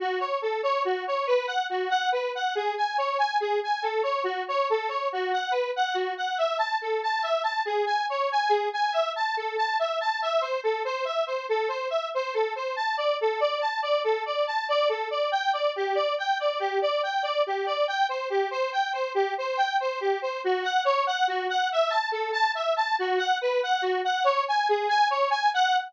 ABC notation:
X:1
M:12/8
L:1/8
Q:3/8=94
K:F#dor
V:1 name="Lead 1 (square)"
F c A c F c B f F f B f | G g c g G g A c F c A c | F f B f F f e a A a e a | G g c g G g e a A a e a |
[K:Ador] e c A c e c A c e c A c | a d A d a d A d a d A d | g d G d g d G d g d G d | g c G c g c G c g c G c |
[K:F#dor] F f c f F f e a A a e a | F f B f F f c g G g c g | f3 z9 |]